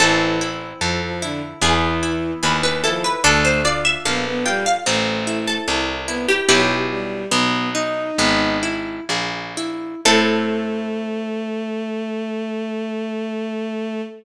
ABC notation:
X:1
M:4/4
L:1/16
Q:1/4=74
K:Am
V:1 name="Harpsichord"
A8 ^G4 B B A B | A c d e f2 g f z3 A z3 G | "^rit." G12 z4 | A16 |]
V:2 name="Violin"
E,2 z2 F, F, D, z E,4 z2 F, z | A,2 z2 B, B, G, z A,4 z2 B, z | "^rit." ^F, z G,2 B,2 ^D4 z6 | A,16 |]
V:3 name="Orchestral Harp"
C2 E2 A2 E2 B,2 E2 ^G2 E2 | D2 F2 A2 F2 C2 E2 A2 E2 | "^rit." [B,E^F]4 B,2 ^D2 B,2 E2 ^G2 E2 | [CEA]16 |]
V:4 name="Harpsichord" clef=bass
A,,,4 F,,4 E,,4 ^D,,4 | D,,4 _B,,,4 A,,,4 C,,4 | "^rit." B,,,4 B,,,4 ^G,,,4 _B,,,4 | A,,16 |]